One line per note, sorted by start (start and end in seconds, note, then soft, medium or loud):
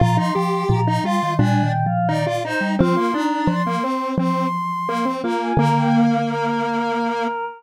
0.00 0.18 A#2 loud
0.00 0.31 F3 medium
0.00 0.17 F4 loud
0.00 0.16 A#5 medium
0.17 0.34 D#4 medium
0.17 0.63 C6 medium
0.35 0.64 F3 medium
0.35 0.81 G4 loud
0.69 0.98 A#2 medium
0.69 1.01 F3 medium
0.69 0.98 A#5 medium
0.87 1.04 D#4 loud
1.04 1.20 G3 medium
1.04 1.34 F4 loud
1.04 1.32 C6 medium
1.23 1.39 D#3 medium
1.39 2.53 A#2 medium
1.39 1.62 G3 medium
1.39 1.72 D4 loud
1.39 1.62 G#5 medium
1.63 1.85 D#3 medium
1.63 1.85 G5 medium
1.86 2.08 F3 medium
1.86 2.08 F5 medium
2.09 2.26 D#3 medium
2.09 2.25 D#4 loud
2.09 2.37 D5 medium
2.26 2.43 F4 medium
2.44 2.75 D#4 medium
2.44 2.61 C5 medium
2.61 2.77 G3 medium
2.79 2.97 F3 loud
2.79 2.95 C4 loud
2.79 3.11 F4 medium
2.79 3.13 C6 medium
2.97 3.13 A#3 medium
3.14 3.62 D4 medium
3.14 3.47 D#4 medium
3.14 3.47 A#5 medium
3.47 3.78 F3 medium
3.47 4.07 C6 medium
3.66 3.83 A#3 medium
3.83 4.15 C4 medium
4.18 5.32 F3 medium
4.18 4.47 C4 medium
4.18 5.11 C6 medium
4.89 5.05 A#3 loud
5.05 5.22 C4 medium
5.24 5.53 A#3 medium
5.24 5.58 F4 medium
5.24 5.40 A#5 medium
5.41 5.58 G#5 medium
5.57 7.50 D3 loud
5.57 7.27 A#3 loud
5.57 6.17 A#3 medium
5.57 5.75 A#5 medium
5.76 5.92 G5 medium
5.92 6.22 F5 medium
6.27 7.45 A#4 medium